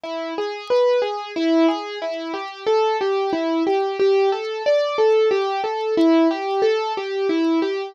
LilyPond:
\new Staff { \time 3/4 \key d \major \tempo 4 = 91 e'8 gis'8 b'8 gis'8 e'8 gis'8 | e'8 g'8 a'8 g'8 e'8 g'8 | g'8 a'8 d''8 a'8 g'8 a'8 | e'8 g'8 a'8 g'8 e'8 g'8 | }